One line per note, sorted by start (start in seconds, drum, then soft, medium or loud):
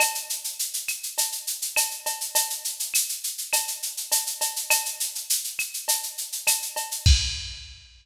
0.00 cowbell loud
0.00 claves loud
0.00 shaker loud
0.15 shaker medium
0.30 shaker medium
0.44 shaker medium
0.59 shaker loud
0.74 shaker medium
0.88 claves medium
0.88 shaker medium
1.03 shaker medium
1.18 cowbell medium
1.18 shaker loud
1.32 shaker medium
1.47 shaker medium
1.62 shaker medium
1.76 cowbell loud
1.76 claves loud
1.76 shaker loud
1.91 shaker medium
2.06 cowbell loud
2.06 shaker medium
2.21 shaker medium
2.35 cowbell loud
2.35 shaker loud
2.50 shaker medium
2.65 shaker medium
2.80 shaker medium
2.94 claves medium
2.94 shaker loud
3.09 shaker medium
3.24 shaker medium
3.38 shaker medium
3.53 cowbell loud
3.53 claves loud
3.53 shaker loud
3.68 shaker medium
3.82 shaker medium
3.97 shaker medium
4.12 cowbell medium
4.12 shaker loud
4.26 shaker medium
4.41 cowbell medium
4.41 shaker loud
4.56 shaker medium
4.70 cowbell loud
4.70 claves loud
4.70 shaker loud
4.85 shaker medium
5.00 shaker loud
5.15 shaker medium
5.30 shaker loud
5.44 shaker medium
5.59 claves loud
5.59 shaker medium
5.74 shaker medium
5.88 cowbell medium
5.88 shaker loud
6.03 shaker medium
6.18 shaker medium
6.32 shaker medium
6.47 cowbell medium
6.47 claves loud
6.47 shaker loud
6.62 shaker medium
6.76 cowbell loud
6.76 shaker medium
6.91 shaker medium
7.06 kick loud
7.06 crash loud